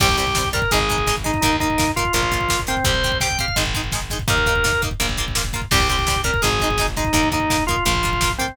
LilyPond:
<<
  \new Staff \with { instrumentName = "Drawbar Organ" } { \time 4/4 \key c \minor \tempo 4 = 168 g'8 g'4 bes'8 aes'4. ees'8 | ees'8 ees'4 f'8 f'4. c'8 | c''4 g''8 f''8 r2 | bes'4. r2 r8 |
g'8 g'4 bes'8 aes'4. ees'8 | ees'8 ees'4 f'8 f'4. c'8 | }
  \new Staff \with { instrumentName = "Acoustic Guitar (steel)" } { \time 4/4 \key c \minor <g c'>8 <g c'>8 <g c'>8 <g c'>8 <aes ees'>8 <aes ees'>8 <aes ees'>8 <aes ees'>8 | <bes ees'>8 <bes ees'>8 <bes ees'>8 <bes ees'>8 <bes f'>8 <bes f'>8 <bes f'>8 <bes f'>8 | <c' g'>8 <c' g'>8 <c' g'>8 <c' g'>8 <aes ees'>8 <aes ees'>8 <aes ees'>8 <aes ees'>8 | <bes ees'>8 <bes ees'>8 <bes ees'>8 <bes ees'>8 <bes f'>8 <bes f'>8 <bes f'>8 <bes f'>8 |
<g c'>8 <g c'>8 <g c'>8 <g c'>8 <aes ees'>8 <aes ees'>8 <aes ees'>8 <aes ees'>8 | <bes ees'>8 <bes ees'>8 <bes ees'>8 <bes ees'>8 <bes f'>8 <bes f'>8 <bes f'>8 <bes f'>8 | }
  \new Staff \with { instrumentName = "Electric Bass (finger)" } { \clef bass \time 4/4 \key c \minor c,2 aes,,2 | ees,2 bes,,2 | c,2 aes,,2 | ees,2 bes,,2 |
c,2 aes,,2 | ees,2 bes,,2 | }
  \new DrumStaff \with { instrumentName = "Drums" } \drummode { \time 4/4 <cymc bd>16 bd16 <hh bd>16 bd16 <bd sn>16 bd16 <hh bd>16 bd16 <hh bd>16 bd16 <hh bd>16 bd16 <bd sn>16 bd16 <hh bd sn>16 bd16 | <hh bd>16 bd16 <hh bd>16 bd16 <bd sn>16 bd16 <hh bd>16 bd16 <hh bd>16 bd16 <hh bd>16 bd16 <bd sn>16 bd16 <hh bd sn>16 bd16 | <hh bd>16 bd16 <hh bd>16 bd16 <bd sn>16 bd16 <hh bd>16 bd16 <hh bd>16 bd16 <hh bd>16 bd16 <bd sn>16 bd16 <hh bd sn>16 bd16 | <hh bd>16 bd16 <hh bd>16 bd16 <bd sn>16 bd16 <hh bd>16 bd16 <hh bd>16 bd16 <hh bd>16 bd16 <bd sn>16 bd16 <hh bd sn>16 bd16 |
<cymc bd>16 bd16 <hh bd>16 bd16 <bd sn>16 bd16 <hh bd>16 bd16 <hh bd>16 bd16 <hh bd>16 bd16 <bd sn>16 bd16 <hh bd sn>16 bd16 | <hh bd>16 bd16 <hh bd>16 bd16 <bd sn>16 bd16 <hh bd>16 bd16 <hh bd>16 bd16 <hh bd>16 bd16 <bd sn>16 bd16 <hh bd sn>16 bd16 | }
>>